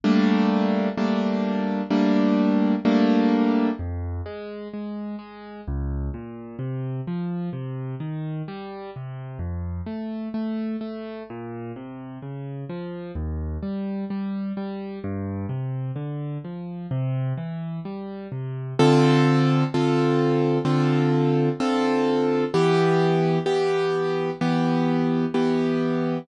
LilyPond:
\new Staff { \time 4/4 \key c \minor \tempo 4 = 64 <g a bes d'>4 <g a bes d'>4 <g a bes d'>4 <g a bes d'>4 | \key f \minor f,8 aes8 aes8 aes8 des,8 bes,8 c8 f8 | c8 ees8 g8 c8 f,8 a8 a8 a8 | bes,8 c8 des8 f8 ees,8 g8 g8 g8 |
g,8 c8 d8 f8 c8 e8 g8 c8 | \key d \minor <d c' f' a'>4 <d c' f' a'>4 <d c' f' a'>4 <d c' f' a'>4 | <e b g'>4 <e b g'>4 <e b g'>4 <e b g'>4 | }